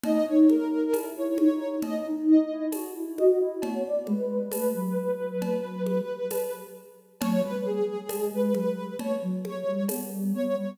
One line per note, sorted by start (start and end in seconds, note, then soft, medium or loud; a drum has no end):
0.03 0.25 D#4 medium
0.03 0.26 D#5 loud
0.03 cowbell medium
0.03 low conga loud
0.26 0.64 D#4 medium
0.26 0.47 C#5 medium
0.49 1.05 A#4 medium
0.49 high conga medium
0.93 1.15 E4 medium
0.93 tambourine medium
0.93 cowbell medium
0.93 high conga medium
1.16 1.37 E4 medium
1.16 1.37 C#5 medium
1.38 1.77 D#4 medium
1.38 1.74 C#5 medium
1.38 high conga medium
1.82 2.04 D#5 medium
1.82 cowbell medium
1.82 low conga medium
2.06 2.45 D#4 medium
2.28 2.66 D#5 medium
2.50 2.72 E4 medium
2.72 2.94 F#4 medium
2.72 tambourine medium
2.72 cowbell medium
2.72 high conga medium
2.95 3.17 E4 medium
3.18 3.39 F#4 medium
3.18 3.39 D#5 medium
3.18 high conga medium
3.40 3.61 E4 medium
3.40 3.62 D#5 medium
3.62 3.83 B3 medium
3.62 3.83 C#5 medium
3.62 cowbell medium
3.62 low conga medium
3.85 4.07 D5 medium
4.07 4.49 G#3 medium
4.07 4.46 B4 medium
4.07 high conga medium
4.51 4.73 A3 medium
4.51 6.61 B4 medium
4.51 tambourine medium
4.51 cowbell medium
4.51 high conga medium
4.74 6.01 F#3 medium
5.42 cowbell medium
5.42 low conga medium
5.86 high conga medium
6.30 tambourine medium
6.30 cowbell medium
6.30 high conga medium
7.21 7.42 F#3 loud
7.21 7.42 C#5 loud
7.21 cowbell medium
7.21 low conga loud
7.43 7.79 G3 medium
7.43 7.64 B4 loud
7.65 8.25 G#4 medium
8.09 8.31 G#3 medium
8.09 tambourine medium
8.09 cowbell medium
8.09 high conga loud
8.32 8.54 G#3 medium
8.32 8.53 B4 medium
8.54 8.97 F#3 medium
8.54 8.94 B4 medium
8.54 high conga medium
8.99 9.21 C#5 medium
8.99 cowbell medium
8.99 low conga medium
9.22 9.64 F#3 medium
9.45 9.83 C#5 medium
9.45 high conga medium
9.67 9.88 G3 medium
9.88 10.10 B3 medium
9.88 tambourine medium
9.88 cowbell medium
9.88 high conga medium
10.12 10.33 G3 medium
10.34 10.55 B3 medium
10.34 10.55 C#5 loud
10.56 10.77 G3 loud
10.56 10.78 C#5 medium